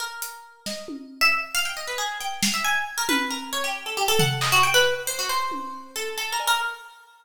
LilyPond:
<<
  \new Staff \with { instrumentName = "Orchestral Harp" } { \time 5/4 \tempo 4 = 136 bes'4. ees''8 r8. e''16 r8 f''16 g''16 ees''16 b'16 aes'8 | g''8 f''16 e''16 aes''8 r16 bes'16 b'8 bes'8 des''16 g'8 a'16 g'16 a'16 ges''8 | ees''16 ges'16 g''16 b'8 r16 c''16 ges'16 c''4. a'8 \tuplet 3/2 { a'8 bes'8 bes'8 } | }
  \new DrumStaff \with { instrumentName = "Drums" } \drummode { \time 5/4 r8 hh8 r8 sn8 tommh4 r4 r4 | hh8 sn8 r4 tommh4 r4 r8 tomfh8 | hc4 r4 r8 tommh8 r4 r8 cb8 | }
>>